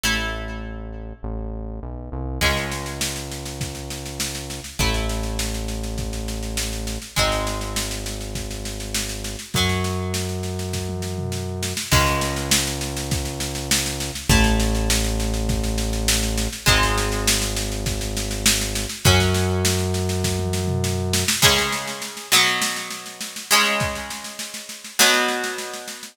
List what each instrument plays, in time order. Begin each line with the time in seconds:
0.03 synth bass 1 A1, acoustic guitar (steel) A3 E4
1.23 synth bass 1 A1
1.83 synth bass 1 B1
2.12 synth bass 1 C2
2.41 synth bass 1 C#2, acoustic guitar (steel) G#3 C#4, kick, snare, crash
2.57 snare
2.72 snare
2.86 snare
3.01 snare
3.16 snare
3.31 snare
3.46 snare
3.61 kick, snare
3.75 snare
3.90 snare
4.06 snare
4.20 snare
4.35 snare
4.50 snare
4.64 snare
4.79 synth bass 1 A1, acoustic guitar (steel) A3 E4, kick, snare
4.94 snare
5.09 snare
5.23 snare
5.39 snare
5.54 snare
5.68 snare
5.83 snare
5.98 kick, snare
6.13 snare
6.28 snare
6.43 snare
6.57 snare
6.73 snare
6.87 snare
7.02 snare
7.16 synth bass 1 G#1, acoustic guitar (steel) G#3 C4 D#4, kick, snare
7.32 snare
7.47 snare
7.61 snare
7.76 snare
7.91 snare
8.06 snare
8.21 snare
8.35 kick, snare
8.51 snare
8.65 snare
8.80 snare
8.94 snare
9.09 snare
9.24 snare
9.39 snare
9.54 synth bass 1 F#2, acoustic guitar (steel) F#3 C#4, kick, snare
9.69 snare
9.84 snare
10.14 snare
10.29 snare
10.43 snare
10.59 snare
10.73 kick, snare
10.89 high tom
11.02 snare
11.18 mid tom
11.32 snare
11.63 snare
11.77 snare
11.91 synth bass 1 C#2, acoustic guitar (steel) G#3 C#4, kick, snare, crash
12.06 snare
12.21 snare
12.36 snare
12.51 snare
12.67 snare
12.81 snare
12.97 snare
13.11 kick, snare
13.25 snare
13.40 snare
13.55 snare
13.71 snare
13.86 snare
14.00 snare
14.15 snare
14.29 synth bass 1 A1, acoustic guitar (steel) A3 E4, kick, snare
14.44 snare
14.60 snare
14.75 snare
14.90 snare
15.04 snare
15.20 snare
15.34 snare
15.49 kick, snare
15.63 snare
15.78 snare
15.93 snare
16.08 snare
16.23 snare
16.37 snare
16.52 snare
16.66 synth bass 1 G#1, acoustic guitar (steel) G#3 C4 D#4, kick, snare
16.83 snare
16.98 snare
17.12 snare
17.27 snare
17.42 snare
17.56 snare
17.72 snare
17.86 kick, snare
18.01 snare
18.17 snare
18.31 snare
18.46 snare
18.61 snare
18.75 snare
18.89 snare
19.05 synth bass 1 F#2, acoustic guitar (steel) F#3 C#4, kick, snare
19.20 snare
19.34 snare
19.65 snare
19.79 snare
19.94 snare
20.09 snare
20.24 kick, snare
20.39 high tom
20.53 snare
20.67 mid tom
20.84 snare
21.13 snare
21.28 snare
21.42 acoustic guitar (steel) C#3 G#3 C#4, kick, snare, crash
21.58 snare
21.72 snare
21.87 snare
22.02 snare
22.17 snare
22.32 acoustic guitar (steel) B2 F#3 B3, snare
22.46 snare
22.62 snare
22.76 snare
22.90 snare
23.06 snare
23.21 snare
23.36 snare
23.51 acoustic guitar (steel) C#3 G#3 C#4, snare
23.65 snare
23.80 kick, snare
23.95 snare
24.10 snare
24.24 snare
24.39 snare
24.54 snare
24.69 snare
24.84 snare
24.99 acoustic guitar (steel) B2 F#3 B3, snare
25.13 snare
25.28 snare
25.44 snare
25.58 snare
25.74 snare
25.88 snare
26.03 snare